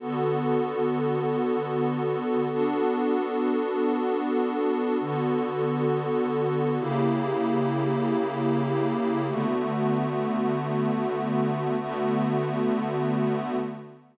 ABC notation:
X:1
M:7/8
L:1/8
Q:1/4=84
K:D
V:1 name="Pad 5 (bowed)"
[D,B,FA]7 | [B,DFA]7 | [M:5/8] [D,B,FA]5 | [M:7/8] [C,_B,EG]7 |
[D,A,B,F]7 | [M:5/8] [D,A,B,F]5 |]